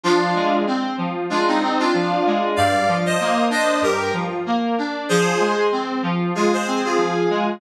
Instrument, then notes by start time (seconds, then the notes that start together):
electric piano 2
0.04 F3 D4 F4
0.35 G#3
0.67 C4
0.98 F3
1.30 G#3 D4 F4
1.48 C4 D#4
1.63 C4
1.79 D4 F4
1.94 F3
2.26 G#3
2.56 G2 D5 F5
2.88 F3
3.06 C5 D#5
3.20 A#3
3.50 D4 C5 D#5
3.82 G2 G4 A#4
4.13 F3
4.46 A#3
4.78 D4
5.09 F3 G#4 C5
5.40 G#3
5.72 C4
6.03 F3
6.35 G#3 F4 G#4
6.53 G#4 C5
6.67 C4
6.85 F4 G#4
6.98 F3
7.30 G#3